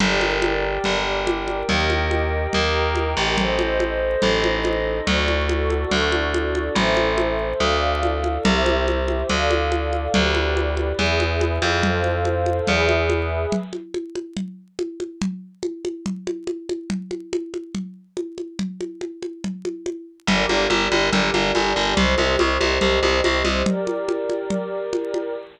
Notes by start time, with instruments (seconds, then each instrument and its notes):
0.00 electric bass (finger) G1, pad 2 (warm) G4 A#4 D5, pad 5 (bowed) A#4 D5 G5, low conga
0.21 high conga
0.42 high conga
0.84 electric bass (finger) G1, pad 5 (bowed) G4 A#4 G5, low conga
1.27 high conga
1.48 high conga
1.68 electric bass (finger) D#2, pad 2 (warm) G4 A#4 D#5, pad 5 (bowed) A#4 D#5 G5, low conga
1.90 high conga
2.11 high conga
2.53 electric bass (finger) D#2, pad 5 (bowed) A#4 G5 A#5, low conga
2.95 high conga
3.17 electric bass (finger) A1
3.37 pad 2 (warm) A4 C5 D#5, pad 5 (bowed) A4 C5 D#5, low conga
3.59 high conga
3.80 high conga
4.22 electric bass (finger) A1, pad 5 (bowed) D#4 A4 D#5, low conga
4.44 high conga
4.65 high conga
5.07 electric bass (finger) D2, pad 2 (warm) F#4 A4 D5, pad 5 (bowed) F#4 A4 D5, low conga
5.28 high conga
5.49 high conga
5.70 high conga
5.91 electric bass (finger) D2, pad 5 (bowed) D4 F#4 D5, low conga
6.12 high conga
6.34 high conga
6.55 high conga
6.75 electric bass (finger) A1, pad 2 (warm) A4 C5 E5, low conga
6.97 high conga
7.18 high conga
7.60 electric bass (finger) D2, pad 2 (warm) A4 D5 F5, low conga
8.03 high conga
8.24 high conga
8.45 electric bass (finger) C2, pad 2 (warm) G4 C5 E5, low conga
8.66 high conga
8.88 high conga
9.08 high conga
9.29 electric bass (finger) D2, pad 2 (warm) A4 D5 F5, low conga
9.51 high conga
9.72 high conga
9.93 high conga
10.14 electric bass (finger) D2, pad 2 (warm) G4 B4 D5, low conga
10.35 high conga
10.57 high conga
10.77 high conga
10.99 electric bass (finger) E2, pad 2 (warm) G#4 B4 E5, low conga
11.20 high conga
11.41 high conga
11.62 electric bass (finger) F2, high conga
11.83 pad 2 (warm) A4 C5 F5, low conga
12.04 high conga
12.25 high conga
12.46 high conga
12.67 electric bass (finger) E2, pad 2 (warm) G#4 B4 E5, low conga
12.89 high conga
13.10 high conga
13.52 low conga
13.73 high conga
13.94 high conga
14.15 high conga
14.37 low conga
14.79 high conga
15.00 high conga
15.22 low conga
15.63 high conga
15.85 high conga
16.06 low conga
16.27 high conga
16.47 high conga
16.69 high conga
16.90 low conga
17.11 high conga
17.33 high conga
17.54 high conga
17.75 low conga
18.17 high conga
18.38 high conga
18.59 low conga
18.81 high conga
19.01 high conga
19.23 high conga
19.44 low conga
19.65 high conga
19.86 high conga
20.27 electric bass (finger) G1, pad 2 (warm) G4 A#4 D5, low conga
20.49 electric bass (finger) G1, high conga
20.70 electric bass (finger) G1, high conga
20.92 electric bass (finger) G1, high conga
21.12 electric bass (finger) G1, low conga
21.34 electric bass (finger) G1, high conga
21.55 electric bass (finger) G1, high conga
21.76 electric bass (finger) G1
21.97 electric bass (finger) C2, pad 2 (warm) G4 C5 D#5, low conga
22.18 electric bass (finger) C2, high conga
22.39 electric bass (finger) C2, high conga
22.61 electric bass (finger) C2, high conga
22.81 electric bass (finger) C2, low conga
23.03 electric bass (finger) C2, high conga
23.24 electric bass (finger) C2, high conga
23.45 electric bass (finger) C2, high conga
23.65 pad 2 (warm) G4 A#4 D5, low conga
23.87 high conga
24.09 high conga
24.30 high conga
24.50 low conga
24.93 high conga
25.14 high conga